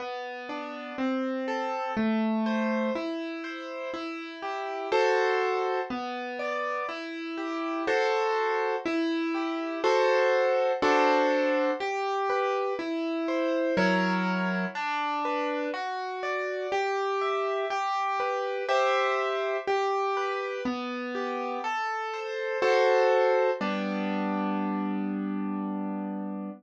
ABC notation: X:1
M:3/4
L:1/8
Q:1/4=61
K:G
V:1 name="Acoustic Grand Piano"
B, D C A A, c | E c E G [FAc]2 | B, d E G [FAc]2 | E G [FAc]2 [DFAc]2 |
G B E c [F,E^A^c]2 | D B F d G e | G B [Gce]2 G B | B, G A c [FAc]2 |
[G,B,D]6 |]